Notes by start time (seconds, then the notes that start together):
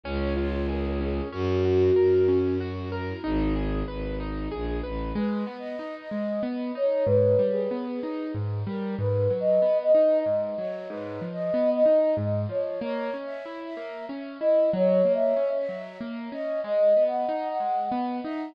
0.03 C#2 C#4
0.20 C#5
0.37 F4 C#5
0.68 G#4 A#4
1.00 C#4 G#4
1.32 F#2 C#4 F#4
1.65 F#4
1.95 F#2 A#4
2.28 C#4
2.60 F#4
2.92 A#4
3.08 E4
3.24 G#1 D#4 G#4
3.56 G#4
3.87 G#1 B4
4.20 D#4
4.51 A#1 G#4
4.83 A1 B4
5.15 G#3 B4
5.47 B3
5.59 D#5
5.79 D#4
6.01 D#5
6.11 G#3
6.43 B3
6.75 D#4 C#5
7.06 G#2 B4
7.39 G3
7.51 G#4
7.71 B3
7.92 G#4
8.03 D#4
8.34 G#2
8.67 G3 A#4
8.99 G#2 B4
9.30 F#3
9.40 D#5
9.62 B3
9.83 D#5
9.95 D#4
10.26 G#2
10.58 F#3 C#5
10.89 G#2 B4
11.22 F3
11.33 D#5
11.54 B3
11.75 D#5
11.86 D#4
12.17 G#2
12.49 F3 C#5
12.81 A#3 C#5
13.14 C#4
13.25 E5
13.45 E4
13.65 E5
13.77 A#3
14.09 C#4
14.40 E4 D#5
14.73 F#3 C#5
15.05 A#3
15.15 E5
15.37 C#4
15.58 E5
15.69 F#3
16.01 A#3
16.32 C#4 D#5
16.64 G#3 D#5
16.96 B3
17.08 F#5
17.29 D#4
17.49 F#5
17.60 G#3
17.91 B3
18.23 D#4 E5